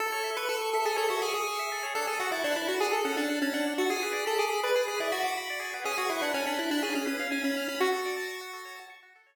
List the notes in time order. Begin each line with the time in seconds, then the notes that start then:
0.00 A4
0.12 C#5
0.24 E5
0.36 B4 C#6
0.49 A4 E6
0.61 C#6
0.73 A4 E5
0.85 G#4 A4
0.96 A4 C#5
1.09 F#4 E5
1.22 G#4 C#6
1.33 G#4 E6
1.47 C#6
1.59 E5
1.72 A4
1.83 C#5
1.95 D4 A4
2.07 G#4 A4
2.20 F#4 F#5
2.32 E4 A5
2.44 D4 F#6
2.56 E4 A5
2.68 F#4 F#5
2.80 D4 G#4
2.91 A4
3.05 C#4 F#5
3.17 D4 A5
3.29 F#6
3.42 C#4 A5
3.53 D4 F#5
3.67 D4
3.78 F#4 A4
3.90 G#4
4.03 B4
4.13 D5
4.26 A4 B5
4.38 G#4 D6
4.50 B5
4.63 B4 D5
4.75 G#4
4.88 G#4 B4
5.00 E4 D5
5.12 F#4 B5
5.22 F#4 D6
5.37 B5
5.50 D5
5.60 G#4
5.73 B4
5.84 C#4 G#4
5.97 F#4 G#4
6.10 E4 B4
6.21 D4 F#5
6.34 C#4 G#5
6.46 D4 B5
6.58 E4 F#6
6.71 D4 B5
6.83 C#4 G#4
6.94 C#4 G#4
7.06 C#4 B4
7.19 F5
7.31 C#4 G#5
7.44 C#4 B5
7.57 F6
7.68 C#4 B5
7.80 F#4
7.92 A4
8.05 D5
8.16 A5
8.27 C#6
8.41 F#4
8.53 A4
8.65 C#5
8.76 A5
8.90 C#6
9.03 F#4
9.16 A4
9.26 C#5